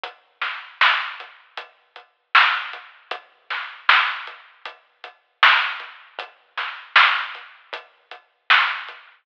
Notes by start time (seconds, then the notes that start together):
0.03 kick, closed hi-hat
0.42 snare, closed hi-hat
0.81 snare
1.20 closed hi-hat
1.57 kick, closed hi-hat
1.96 closed hi-hat
2.35 snare
2.73 closed hi-hat
3.11 kick, closed hi-hat
3.50 snare, closed hi-hat
3.89 snare
4.27 closed hi-hat
4.65 kick, closed hi-hat
5.04 closed hi-hat
5.43 snare
5.80 closed hi-hat
6.19 kick, closed hi-hat
6.57 snare, closed hi-hat
6.96 snare
7.35 closed hi-hat
7.73 kick, closed hi-hat
8.11 closed hi-hat
8.50 snare
8.88 closed hi-hat